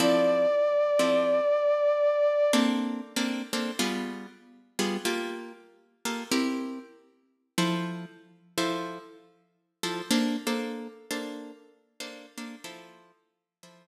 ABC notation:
X:1
M:4/4
L:1/8
Q:"Swing" 1/4=95
K:F
V:1 name="Brass Section"
d8 | z8 | z8 | z8 |
z8 | z8 |]
V:2 name="Acoustic Guitar (steel)"
[F,CEA]3 [F,CEA]5 | [B,CDA]2 [B,CDA] [B,CDA] [G,=B,F_A]3 [G,B,FA] | [B,FGA]3 [B,FGA] [CEGB]4 | [F,EAc]3 [F,EAc]4 [F,EAc] |
[B,DAc] [B,DAc]2 [B,DAc]3 [B,DAc] [B,DAc] | [F,EAc]3 [F,EAc]4 z |]